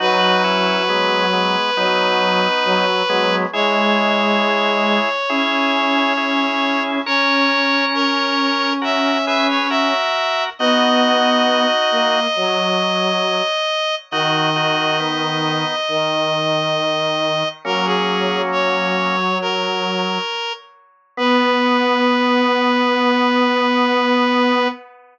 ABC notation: X:1
M:4/4
L:1/16
Q:1/4=68
K:B
V:1 name="Clarinet"
B16 | c16 | c4 A4 e2 e c e4 | d16 |
d16 | A G3 c4 A6 z2 | B16 |]
V:2 name="Drawbar Organ"
[DF]2 [CE]2 [G,B,]2 [G,B,]2 [B,D]6 [G,B,]2 | [EG]8 [EG]4 [EG]4 | [Ac]8 [FA]2 [GB]2 [FA]4 | [DF]8 z8 |
[DF]2 [DF]2 [B,D]4 z8 | [A,C]8 z8 | B,16 |]
V:3 name="Violin"
F,8 F,4 F,2 F,2 | G,8 C8 | C16 | B,6 A,2 F,6 z2 |
D,8 D,8 | F,12 z4 | B,16 |]